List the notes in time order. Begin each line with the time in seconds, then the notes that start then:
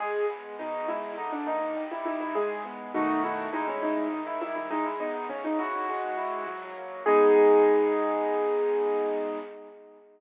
0.00 G#3 G#4
0.29 B3
0.59 B2 D#4
0.88 G#3 E4
1.18 D3 D#4
1.32 D4
1.46 A#3 D#4
1.77 G3
1.91 E4
2.05 D#4 E4
2.21 E4
2.35 G#3 G#4
2.65 B3
2.94 B2 D#3 A3 D#4 F#4
3.24 E4
3.53 B2 G#3 D#4 E4
3.68 C#4
3.82 D#4
4.12 D#3
4.27 E4
4.41 G3 E4
4.56 E4
4.70 G#3 D#4
4.86 E4
5.00 B3 D#4
5.29 C#3 C#4
5.44 D#4
5.59 E4 F#4
5.89 G#3
6.17 E4
6.47 F#3
6.76 A#3
7.06 G#3 B3 D#4 G#4